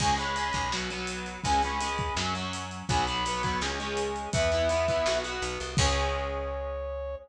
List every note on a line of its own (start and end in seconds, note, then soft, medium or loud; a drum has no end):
0.00 0.51 C#2 medium
0.00 0.16 G#3 loud
0.00 0.16 C#4 medium
0.00 0.14 G#5 loud
0.00 kick medium
0.00 crash loud
0.18 0.35 G#3 medium
0.18 0.35 C#4 loud
0.18 0.69 B5 loud
0.18 closed hi-hat medium
0.36 0.69 G#3 medium
0.36 0.69 C#4 medium
0.36 closed hi-hat medium
0.53 1.38 B1 medium
0.53 kick medium
0.53 closed hi-hat medium
0.72 0.89 F#3 loud
0.72 0.89 B3 medium
0.72 snare medium
0.90 1.40 F#3 medium
0.90 1.40 B3 medium
0.90 closed hi-hat medium
1.07 closed hi-hat medium
1.26 closed hi-hat medium
1.44 2.11 C#2 medium
1.44 1.61 G#3 medium
1.44 1.61 C#4 loud
1.44 1.62 G#5 loud
1.44 kick medium
1.44 closed hi-hat medium
1.62 1.79 G#3 medium
1.62 1.79 C#4 medium
1.62 2.13 B5 medium
1.62 closed hi-hat medium
1.80 2.14 G#3 medium
1.80 2.14 C#4 medium
1.80 closed hi-hat medium
1.98 kick medium
1.98 closed hi-hat medium
2.16 2.83 F#2 medium
2.16 2.33 F#3 loud
2.16 2.33 C#4 loud
2.16 snare medium
2.35 2.84 F#3 medium
2.35 2.84 C#4 medium
2.35 closed hi-hat medium
2.53 closed hi-hat medium
2.71 closed hi-hat medium
2.88 3.56 B1 medium
2.88 3.06 F#3 loud
2.88 3.06 B3 loud
2.88 3.04 G#5 loud
2.88 kick medium
2.88 closed hi-hat medium
3.06 3.24 F#3 medium
3.06 3.24 B3 medium
3.06 3.55 B5 loud
3.06 closed hi-hat medium
3.25 3.42 F#3 medium
3.25 3.42 B3 medium
3.25 closed hi-hat medium
3.43 3.60 F#3 medium
3.43 3.60 B3 medium
3.43 kick medium
3.43 closed hi-hat medium
3.61 4.28 C#2 medium
3.61 3.78 G#3 loud
3.61 3.78 C#4 loud
3.61 snare medium
3.80 4.30 G#3 loud
3.80 4.30 C#4 medium
3.80 closed hi-hat medium
3.97 closed hi-hat medium
4.16 closed hi-hat medium
4.33 5.01 E2 medium
4.33 4.50 B3 loud
4.33 4.50 E4 medium
4.33 5.19 E5 loud
4.33 kick loud
4.33 closed hi-hat loud
4.52 4.68 B3 loud
4.52 4.68 E4 medium
4.52 closed hi-hat medium
4.69 4.86 B3 medium
4.69 4.86 E4 medium
4.69 closed hi-hat medium
4.88 5.05 B3 medium
4.88 5.05 E4 medium
4.88 kick medium
4.88 closed hi-hat medium
5.06 5.40 B1 medium
5.06 5.23 B3 loud
5.06 5.23 F#4 loud
5.06 snare medium
5.24 5.74 B3 medium
5.24 5.74 F#4 medium
5.24 closed hi-hat medium
5.42 5.58 B1 medium
5.42 closed hi-hat medium
5.60 5.77 C2 medium
5.60 closed hi-hat medium
5.77 7.16 C#2 loud
5.77 7.15 G#3 loud
5.77 7.15 C#4 medium
5.77 7.15 C#5 loud
5.77 kick loud
5.77 crash loud